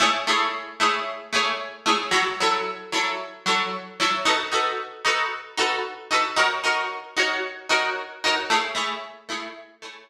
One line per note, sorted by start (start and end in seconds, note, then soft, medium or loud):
0.00 0.10 A3 loud
0.00 0.10 E4 loud
0.00 0.10 G#4 medium
0.00 0.10 C#5 loud
0.27 0.47 A3 medium
0.27 0.47 E4 medium
0.27 0.47 G#4 medium
0.27 0.47 C#5 medium
0.80 1.00 A3 medium
0.80 1.00 E4 medium
0.80 1.00 G#4 medium
0.80 1.00 C#5 medium
1.33 1.52 A3 medium
1.33 1.52 E4 medium
1.33 1.52 G#4 loud
1.33 1.52 C#5 medium
1.86 1.96 A3 medium
1.86 1.96 E4 medium
1.86 1.96 G#4 medium
1.86 1.96 C#5 medium
2.11 2.22 F#3 loud
2.11 2.22 E4 medium
2.11 2.22 A4 loud
2.11 2.22 C#5 medium
2.40 2.60 F#3 medium
2.40 2.60 E4 medium
2.40 2.60 A4 medium
2.40 2.60 C#5 loud
2.92 3.12 F#3 medium
2.92 3.12 E4 medium
2.92 3.12 A4 medium
2.92 3.12 C#5 medium
3.46 3.66 F#3 medium
3.46 3.66 E4 medium
3.46 3.66 A4 medium
3.46 3.66 C#5 medium
4.00 4.10 F#3 medium
4.00 4.10 E4 medium
4.00 4.10 A4 medium
4.00 4.10 C#5 medium
4.25 4.36 D#4 loud
4.25 4.36 F#4 loud
4.25 4.36 A4 medium
4.25 4.36 B4 loud
4.52 4.71 D#4 medium
4.52 4.71 F#4 medium
4.52 4.71 A4 medium
4.52 4.71 B4 medium
5.05 5.24 D#4 medium
5.05 5.24 F#4 loud
5.05 5.24 A4 medium
5.05 5.24 B4 medium
5.57 5.77 D#4 medium
5.57 5.77 F#4 medium
5.57 5.77 A4 medium
5.57 5.77 B4 medium
6.11 6.21 D#4 medium
6.11 6.21 F#4 medium
6.11 6.21 A4 medium
6.11 6.21 B4 medium
6.36 6.47 D#4 loud
6.36 6.47 F#4 loud
6.36 6.47 A#4 loud
6.36 6.47 C#5 loud
6.64 6.83 D#4 loud
6.64 6.83 F#4 medium
6.64 6.83 A#4 medium
6.64 6.83 C#5 medium
7.17 7.36 D#4 medium
7.17 7.36 F#4 medium
7.17 7.36 A#4 medium
7.17 7.36 C#5 medium
7.69 7.89 D#4 medium
7.69 7.89 F#4 loud
7.69 7.89 A#4 medium
7.69 7.89 C#5 medium
8.24 8.35 D#4 medium
8.24 8.35 F#4 medium
8.24 8.35 A#4 medium
8.24 8.35 C#5 medium
8.50 8.61 A3 medium
8.50 8.61 E4 medium
8.50 8.61 G#4 medium
8.50 8.61 C#5 loud
8.75 8.94 A3 medium
8.75 8.94 E4 medium
8.75 8.94 G#4 medium
8.75 8.94 C#5 medium
9.29 9.48 A3 medium
9.29 9.48 E4 loud
9.29 9.48 G#4 medium
9.29 9.48 C#5 medium
9.82 10.02 A3 medium
9.82 10.02 E4 medium
9.82 10.02 G#4 medium
9.82 10.02 C#5 medium